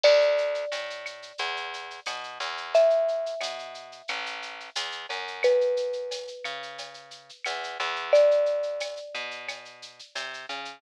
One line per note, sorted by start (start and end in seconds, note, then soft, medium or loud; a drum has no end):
0.04 0.65 D2 loud
0.04 2.64 D5 medium
0.04 crash medium
0.04 cowbell medium
0.04 claves medium
0.21 shaker medium
0.38 shaker medium
0.54 shaker medium
0.72 1.32 A2 medium
0.72 tambourine medium
0.72 cowbell medium
0.72 shaker medium
0.90 shaker medium
1.06 claves medium
1.06 shaker medium
1.22 shaker medium
1.38 2.00 E2 loud
1.38 cowbell medium
1.38 shaker medium
1.57 shaker medium
1.74 shaker medium
1.90 shaker medium
2.06 2.39 B2 medium
2.06 tambourine medium
2.06 cowbell medium
2.06 claves medium
2.06 shaker medium
2.24 shaker medium
2.40 3.35 E2 loud
2.40 cowbell medium
2.40 shaker medium
2.57 shaker medium
2.74 5.35 E5 medium
2.74 cowbell medium
2.74 shaker medium
2.90 shaker medium
3.08 shaker medium
3.26 shaker medium
3.40 4.02 B2 medium
3.40 tambourine medium
3.40 cowbell medium
3.40 claves medium
3.40 shaker loud
3.59 shaker medium
3.74 shaker medium
3.92 shaker medium
4.08 4.70 A1 medium
4.08 cowbell medium
4.08 claves medium
4.08 shaker medium
4.26 shaker medium
4.42 shaker medium
4.60 shaker medium
4.75 5.06 E2 medium
4.75 tambourine medium
4.75 cowbell medium
4.75 shaker loud
4.92 shaker medium
5.09 6.30 F#2 medium
5.09 cowbell medium
5.09 shaker medium
5.27 shaker medium
5.43 7.94 B4 medium
5.43 cowbell medium
5.43 claves medium
5.43 shaker medium
5.61 shaker medium
5.77 shaker medium
5.93 shaker medium
6.11 tambourine medium
6.11 cowbell medium
6.11 shaker medium
6.28 shaker medium
6.44 7.31 C#3 medium
6.44 claves medium
6.44 shaker medium
6.63 shaker medium
6.78 cowbell medium
6.78 shaker medium
6.94 shaker medium
7.11 shaker medium
7.29 shaker medium
7.45 7.78 E2 medium
7.45 tambourine medium
7.45 cowbell medium
7.45 claves medium
7.45 shaker medium
7.64 shaker medium
7.80 8.99 E2 loud
7.80 cowbell medium
7.80 shaker medium
7.96 shaker medium
8.13 10.74 D5 medium
8.13 cowbell medium
8.13 shaker medium
8.31 shaker medium
8.46 shaker medium
8.63 shaker medium
8.80 tambourine medium
8.80 cowbell medium
8.80 claves medium
8.80 shaker medium
8.96 shaker medium
9.15 10.01 B2 medium
9.15 shaker medium
9.31 shaker medium
9.48 cowbell medium
9.48 claves medium
9.48 shaker medium
9.65 shaker medium
9.82 shaker medium
9.99 shaker medium
10.15 10.46 C3 medium
10.15 tambourine medium
10.15 cowbell medium
10.15 shaker medium
10.34 shaker medium
10.49 10.79 C#3 medium
10.49 cowbell medium
10.49 shaker medium
10.65 shaker medium